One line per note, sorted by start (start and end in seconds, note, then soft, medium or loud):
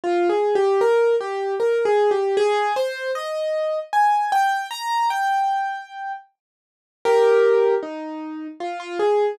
0.04 0.28 F4 loud
0.29 0.54 G#4 medium
0.55 0.80 G4 loud
0.81 1.15 A#4 loud
1.21 1.55 G4 medium
1.60 1.84 A#4 medium
1.85 2.10 G#4 loud
2.11 2.36 G4 medium
2.37 2.73 G#4 loud
2.76 3.11 C5 loud
3.15 3.79 D#5 medium
3.93 4.31 G#5 medium
4.32 4.67 G5 loud
4.71 5.09 A#5 loud
5.10 6.12 G5 loud
7.05 7.75 G4 loud
7.05 7.75 A#4 loud
7.83 8.47 D#4 medium
8.60 8.79 F4 medium
8.80 8.98 F4 loud
9.00 9.35 G#4 medium